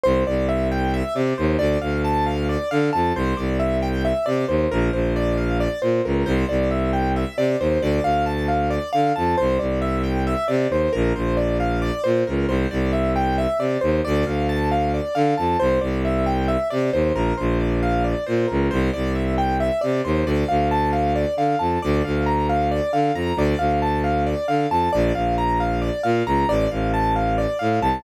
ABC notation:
X:1
M:7/8
L:1/8
Q:1/4=135
K:Dm
V:1 name="Acoustic Grand Piano"
c d e g e d c | d f a f d f a | c d e g e d c | B c d f d c B |
c d e g e d c | d f a f d f a | c d e g e d c | B c d f d c B |
c d e g e d c | d f a f d f a | c d e g e d c | B c d f d c B |
c d e g e d c | d f a f d f a | d f b f d f b | d f a f d f a |
d f b f d f b | d f a f d f a |]
V:2 name="Violin" clef=bass
C,, C,,4 C, _E,, | D,, D,,4 D, F,, | C,, C,,4 C, _E,, | B,,, B,,,4 B,, ^C,, |
C,, C,,4 C, _E,, | D,, D,,4 D, F,, | C,, C,,4 C, _E,, | B,,, B,,,4 B,, ^C,, |
C,, C,,4 C, _E,, | D,, D,,4 D, F,, | C,, C,,4 C, _E,, | B,,, B,,,4 B,, ^C,, |
C,, C,,4 C, _E,, | D,, D,,4 D, F,, | D,, D,,4 D, F,, | D,, D,,4 D, F,, |
B,,, B,,,4 B,, ^C,, | A,,, A,,,4 A,, C,, |]